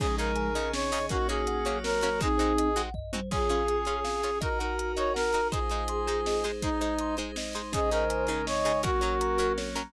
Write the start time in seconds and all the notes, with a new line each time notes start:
0.00 C#3 F3 G#3 C#4 D#4 G#4, kick, crash
0.18 C#3 D#4 G#4 A#4 D#5, closed hi-hat
0.36 G#5, closed hi-hat
0.55 C#3 C#4 D#4 G#4 D#5, closed hi-hat
0.73 C#4 D#4 C#5, snare
0.92 C#3 D#4 G#4 D#5, open hi-hat
1.09 A#3 C#4 D#4 F#4 A#4, kick, closed hi-hat
1.28 A#3 C#4 F#4 G#4 C#5, closed hi-hat
1.47 F#5, closed hi-hat
1.65 F#3 A#3 C#4 F#4 C#5, closed hi-hat
1.84 A#4 C#5, snare
2.01 A#3 C#4 F#4 C#5, closed hi-hat
2.19 G#3 C4 D#4 F#4 G#4, kick, closed hi-hat
2.38 G#3 C4 D#4 F#4 C5, closed hi-hat
2.58 D#5, closed hi-hat
2.76 G#3 C4 D#4 F#4 F#5, closed hi-hat
2.94 D#5, kick, floor tom
3.13 G#3 C4 D#4 F#4 C5, high tom
3.31 C#4 F4 G#4 C#5, kick, crash
3.49 C#4 F4 G#4 F5, closed hi-hat
3.68 G#5, closed hi-hat
3.85 C#4 F4 G#4 C#5, closed hi-hat
4.05 F5, snare
4.23 C#4 F4 G#4 G#5, closed hi-hat
4.41 D#4 F#4 A#4 D#5, kick, closed hi-hat
4.59 D#4 F#4 A#4 F#5, closed hi-hat
4.79 A#5, closed hi-hat
4.97 D#4 F#4 A#4 C#5 D#5, closed hi-hat
5.14 A#4 F#5, snare
5.33 D#4 F#4 A#4 A#5, closed hi-hat
5.52 G#3 D#4 F4 G#4 C5, kick, closed hi-hat
5.70 G#3 D#4 C5 D#5, closed hi-hat
5.88 C6, closed hi-hat
6.07 G#3 D#4 G#4 C5, closed hi-hat
6.26 D#5, snare
6.44 G#3 D#4 G#4 C5, closed hi-hat
6.62 G#3 D#4 C5 D#5, kick, closed hi-hat
6.81 G#3 D#4 C5 D#5, closed hi-hat
6.99 C6, closed hi-hat
7.17 G#3 D#4 G#4 C5, closed hi-hat
7.36 D#5, snare
7.53 G#3 D#4 C5 C6, closed hi-hat
7.72 C#3 G#3 C#4 D#4 G#4 C5 D#5, kick, closed hi-hat
7.91 C#3 D#4 G#4 A#4 D#5, closed hi-hat
8.10 G#5, closed hi-hat
8.27 C#3 C#4 D#4 G#4, closed hi-hat
8.46 C#5 D#5, snare
8.65 C#3 D#4 G#4 G#5, closed hi-hat
8.83 F#3 A#3 C#4 F#4 A#4, kick, closed hi-hat
9.01 F#3 C#4 A#4 C#5, closed hi-hat
9.21 A#5, closed hi-hat
9.37 F#3 C#4 F#4 A#4, closed hi-hat
9.58 C#5, snare
9.75 F#3 C#4 A#4 A#5, closed hi-hat